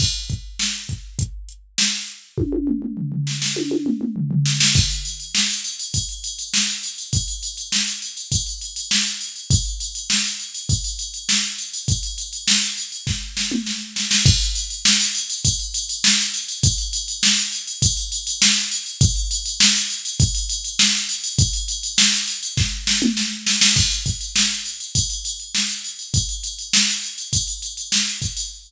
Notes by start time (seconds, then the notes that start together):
0.00 kick, crash
0.30 kick, closed hi-hat
0.59 snare
0.89 kick, closed hi-hat
1.19 kick, closed hi-hat
1.49 closed hi-hat
1.78 snare
2.08 closed hi-hat
2.38 kick, high tom
2.52 high tom
2.67 mid tom
2.82 mid tom
2.97 floor tom
3.12 floor tom
3.27 snare
3.42 snare
3.56 high tom
3.71 high tom
3.86 mid tom
4.01 mid tom
4.16 floor tom
4.31 floor tom
4.46 snare
4.60 snare
4.75 kick, crash
4.90 ride
5.05 ride
5.20 ride
5.35 snare
5.50 ride
5.64 ride
5.79 ride
5.94 kick, ride
6.09 ride
6.24 ride
6.39 ride
6.54 snare
6.68 ride
6.83 ride
6.98 ride
7.13 kick, ride
7.28 ride
7.43 ride
7.57 ride
7.72 snare
7.87 ride
8.02 ride
8.17 ride
8.32 kick, ride
8.46 ride
8.61 ride
8.76 ride
8.91 snare
9.06 ride
9.21 ride
9.36 ride
9.50 kick, ride
9.65 ride
9.80 ride
9.95 ride
10.10 snare
10.25 ride
10.39 ride
10.54 ride
10.69 kick, ride
10.84 ride
10.99 ride
11.14 ride
11.29 snare
11.43 ride
11.58 ride
11.73 ride
11.88 kick, ride
12.03 ride
12.18 ride
12.33 ride
12.48 snare
12.62 ride
12.77 ride
12.92 ride
13.07 kick, snare
13.37 snare
13.51 mid tom
13.66 snare
13.96 snare
14.11 snare
14.26 kick, crash
14.41 ride
14.55 ride
14.70 ride
14.85 snare
15.00 ride
15.15 ride
15.30 ride
15.45 kick, ride
15.60 ride
15.74 ride
15.89 ride
16.04 snare
16.19 ride
16.34 ride
16.48 ride
16.63 kick, ride
16.78 ride
16.93 ride
17.08 ride
17.23 snare
17.37 ride
17.52 ride
17.67 ride
17.82 kick, ride
17.97 ride
18.12 ride
18.27 ride
18.42 snare
18.56 ride
18.71 ride
18.86 ride
19.01 kick, ride
19.16 ride
19.31 ride
19.46 ride
19.60 snare
19.75 ride
19.90 ride
20.05 ride
20.20 kick, ride
20.35 ride
20.49 ride
20.64 ride
20.79 snare
20.94 ride
21.09 ride
21.24 ride
21.38 kick, ride
21.53 ride
21.68 ride
21.83 ride
21.98 snare
22.13 ride
22.28 ride
22.43 ride
22.57 kick, snare
22.87 snare
23.02 mid tom
23.17 snare
23.47 snare
23.61 snare
23.76 kick, crash
23.91 ride
24.06 kick, ride
24.21 ride
24.36 snare
24.50 ride
24.65 ride
24.80 ride
24.95 kick, ride
25.10 ride
25.25 ride
25.40 ride
25.55 snare
25.69 ride
25.84 ride
25.99 ride
26.14 kick, ride
26.29 ride
26.43 ride
26.59 ride
26.73 snare
26.88 ride
27.03 ride
27.18 ride
27.33 kick, ride
27.47 ride
27.62 ride
27.77 ride
27.92 snare
28.07 ride
28.22 kick, ride
28.37 ride